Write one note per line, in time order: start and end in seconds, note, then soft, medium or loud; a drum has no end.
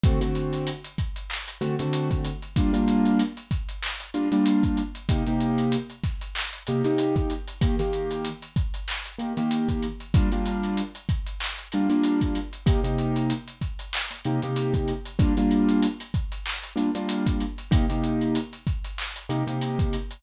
0.04 0.19 D3 medium
0.04 0.19 A3 medium
0.04 0.19 C4 medium
0.04 0.19 F#4 medium
0.04 kick loud
0.04 closed hi-hat medium
0.21 0.70 D3 medium
0.21 0.70 A3 medium
0.21 0.70 C4 medium
0.21 0.70 F#4 medium
0.21 closed hi-hat medium
0.35 closed hi-hat medium
0.53 closed hi-hat medium
0.67 closed hi-hat medium
0.84 closed hi-hat medium
0.98 kick medium
0.98 closed hi-hat medium
1.16 closed hi-hat medium
1.30 clap medium
1.48 closed hi-hat medium
1.61 1.75 D3 medium
1.61 1.75 A3 medium
1.61 1.75 C4 medium
1.61 1.75 F#4 medium
1.61 closed hi-hat medium
1.79 2.29 D3 medium
1.79 2.29 A3 medium
1.79 2.29 C4 medium
1.79 2.29 F#4 medium
1.79 closed hi-hat medium
1.93 closed hi-hat medium
2.11 kick medium
2.11 closed hi-hat medium
2.25 closed hi-hat medium
2.42 closed hi-hat medium
2.56 2.71 G3 medium
2.56 2.71 A#3 medium
2.56 2.71 D4 medium
2.56 2.71 F4 medium
2.56 kick medium
2.56 closed hi-hat medium
2.73 3.22 G3 medium
2.73 3.22 A#3 medium
2.73 3.22 D4 medium
2.73 3.22 F4 medium
2.73 closed hi-hat medium
2.88 closed hi-hat medium
3.05 closed hi-hat medium
3.19 closed hi-hat medium
3.37 closed hi-hat medium
3.51 kick medium
3.51 closed hi-hat medium
3.69 closed hi-hat medium
3.83 clap medium
4.00 closed hi-hat medium
4.14 4.28 G3 medium
4.14 4.28 A#3 medium
4.14 4.28 D4 medium
4.14 4.28 F4 medium
4.14 closed hi-hat medium
4.32 4.81 G3 medium
4.32 4.81 A#3 medium
4.32 4.81 D4 medium
4.32 4.81 F4 medium
4.32 closed hi-hat medium
4.46 closed hi-hat medium
4.63 kick medium
4.63 closed hi-hat medium
4.77 closed hi-hat medium
4.95 closed hi-hat medium
5.09 5.23 C3 medium
5.09 5.23 A#3 medium
5.09 5.23 D#4 medium
5.09 5.23 G4 medium
5.09 kick medium
5.09 closed hi-hat medium
5.26 5.76 C3 medium
5.26 5.76 A#3 medium
5.26 5.76 D#4 medium
5.26 5.76 G4 medium
5.26 closed hi-hat medium
5.40 closed hi-hat medium
5.58 closed hi-hat medium
5.72 closed hi-hat medium
5.90 closed hi-hat medium
6.04 kick medium
6.04 snare soft
6.04 closed hi-hat medium
6.21 closed hi-hat medium
6.35 clap loud
6.53 closed hi-hat medium
6.67 6.82 C3 medium
6.67 6.82 A#3 medium
6.67 6.82 D#4 medium
6.67 6.82 G4 medium
6.67 closed hi-hat medium
6.84 7.33 C3 medium
6.84 7.33 A#3 medium
6.84 7.33 D#4 medium
6.84 7.33 G4 medium
6.84 snare soft
6.84 closed hi-hat medium
6.98 closed hi-hat medium
7.16 kick medium
7.16 closed hi-hat medium
7.30 closed hi-hat medium
7.48 closed hi-hat medium
7.61 7.75 D#3 medium
7.61 7.75 A#3 medium
7.61 7.75 G4 medium
7.61 kick medium
7.61 closed hi-hat medium
7.79 8.28 D#3 medium
7.79 8.28 A#3 medium
7.79 8.28 G4 medium
7.79 snare soft
7.79 closed hi-hat medium
7.93 closed hi-hat medium
8.11 closed hi-hat medium
8.25 closed hi-hat medium
8.42 closed hi-hat medium
8.56 kick medium
8.56 closed hi-hat medium
8.74 closed hi-hat medium
8.88 clap medium
9.05 closed hi-hat medium
9.19 9.33 D#3 medium
9.19 9.33 A#3 medium
9.19 9.33 G4 medium
9.19 closed hi-hat medium
9.37 9.86 D#3 medium
9.37 9.86 A#3 medium
9.37 9.86 G4 medium
9.37 closed hi-hat medium
9.51 closed hi-hat medium
9.69 kick medium
9.69 closed hi-hat medium
9.83 closed hi-hat medium
10.00 closed hi-hat medium
10.14 10.29 G3 medium
10.14 10.29 A#3 medium
10.14 10.29 D4 medium
10.14 10.29 F4 medium
10.14 kick loud
10.14 closed hi-hat medium
10.32 10.81 G3 medium
10.32 10.81 A#3 medium
10.32 10.81 D4 medium
10.32 10.81 F4 medium
10.32 closed hi-hat medium
10.46 closed hi-hat medium
10.63 closed hi-hat medium
10.77 closed hi-hat medium
10.95 closed hi-hat medium
11.09 kick medium
11.09 closed hi-hat medium
11.26 closed hi-hat medium
11.40 clap medium
11.58 closed hi-hat medium
11.72 11.88 G3 medium
11.72 11.88 A#3 medium
11.72 11.88 D4 medium
11.72 11.88 F4 medium
11.72 closed hi-hat medium
11.90 12.39 G3 medium
11.90 12.39 A#3 medium
11.90 12.39 D4 medium
11.90 12.39 F4 medium
11.90 snare soft
11.90 closed hi-hat medium
12.04 closed hi-hat medium
12.21 kick medium
12.21 closed hi-hat medium
12.35 closed hi-hat medium
12.53 closed hi-hat medium
12.66 12.80 C3 medium
12.66 12.80 A#3 medium
12.66 12.80 D#4 medium
12.66 12.80 G4 medium
12.66 kick medium
12.66 closed hi-hat medium
12.84 13.33 C3 medium
12.84 13.33 A#3 medium
12.84 13.33 D#4 medium
12.84 13.33 G4 medium
12.84 closed hi-hat medium
12.98 closed hi-hat medium
13.16 closed hi-hat medium
13.30 closed hi-hat medium
13.48 closed hi-hat medium
13.61 kick medium
13.61 closed hi-hat medium
13.79 closed hi-hat medium
13.93 clap loud
14.11 snare soft
14.11 closed hi-hat medium
14.25 14.39 C3 medium
14.25 14.39 A#3 medium
14.25 14.39 D#4 medium
14.25 14.39 G4 medium
14.25 closed hi-hat medium
14.42 14.92 C3 medium
14.42 14.92 A#3 medium
14.42 14.92 D#4 medium
14.42 14.92 G4 medium
14.42 closed hi-hat medium
14.56 closed hi-hat medium
14.74 kick medium
14.74 closed hi-hat medium
14.88 closed hi-hat medium
15.05 closed hi-hat medium
15.19 15.33 G3 medium
15.19 15.33 A#3 medium
15.19 15.33 D4 medium
15.19 15.33 F4 medium
15.19 kick medium
15.19 closed hi-hat medium
15.37 15.86 G3 medium
15.37 15.86 A#3 medium
15.37 15.86 D4 medium
15.37 15.86 F4 medium
15.37 closed hi-hat medium
15.51 closed hi-hat medium
15.69 closed hi-hat medium
15.83 closed hi-hat loud
16.00 closed hi-hat medium
16.14 kick medium
16.14 closed hi-hat medium
16.32 closed hi-hat medium
16.46 clap medium
16.63 closed hi-hat medium
16.76 16.90 G3 medium
16.76 16.90 A#3 medium
16.76 16.90 D4 medium
16.76 16.90 F4 medium
16.76 snare soft
16.76 closed hi-hat medium
16.95 17.44 G3 medium
16.95 17.44 A#3 medium
16.95 17.44 D4 medium
16.95 17.44 F4 medium
16.95 closed hi-hat medium
17.09 closed hi-hat loud
17.26 kick medium
17.26 closed hi-hat medium
17.40 closed hi-hat medium
17.58 closed hi-hat medium
17.71 17.85 C3 medium
17.71 17.85 A#3 medium
17.71 17.85 D#4 medium
17.71 17.85 G4 medium
17.71 kick medium
17.71 closed hi-hat loud
17.89 18.38 C3 medium
17.89 18.38 A#3 medium
17.89 18.38 D#4 medium
17.89 18.38 G4 medium
17.89 closed hi-hat medium
18.04 closed hi-hat medium
18.21 closed hi-hat medium
18.35 closed hi-hat medium
18.53 closed hi-hat medium
18.67 kick medium
18.67 closed hi-hat medium
18.84 closed hi-hat medium
18.98 clap medium
19.16 closed hi-hat medium
19.29 19.43 C3 medium
19.29 19.43 A#3 medium
19.29 19.43 D#4 medium
19.29 19.43 G4 medium
19.29 snare soft
19.29 closed hi-hat medium
19.47 19.96 C3 medium
19.47 19.96 A#3 medium
19.47 19.96 D#4 medium
19.47 19.96 G4 medium
19.47 closed hi-hat medium
19.61 closed hi-hat medium
19.79 kick medium
19.79 closed hi-hat medium
19.93 closed hi-hat medium
20.11 closed hi-hat medium